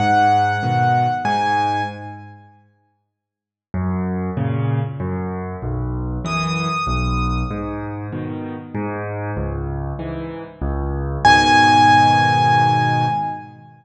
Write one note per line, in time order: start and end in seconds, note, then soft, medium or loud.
0.00 0.56 G#2 loud
0.00 1.14 F#5 medium
0.63 1.07 B2 medium
0.63 1.07 D#3 medium
1.25 1.81 G#2 loud
1.25 1.83 G#5 medium
3.74 4.30 F#2 loud
4.37 4.81 A#2 medium
4.37 4.81 C#3 loud
5.00 5.56 F#2 loud
5.62 6.19 B1 loud
6.25 6.68 F#2 medium
6.25 6.68 E3 medium
6.25 7.39 D#6 medium
6.87 7.43 B1 loud
7.51 8.07 G#2 loud
8.12 8.56 B2 medium
8.12 8.56 D#3 medium
8.75 9.31 G#2 loud
9.37 9.93 C#2 loud
9.99 10.43 G#2 medium
9.99 10.43 E3 medium
10.62 11.18 C#2 loud
11.25 13.06 G#2 loud
11.25 13.06 B2 medium
11.25 13.06 D#3 loud
11.25 13.05 G#5 loud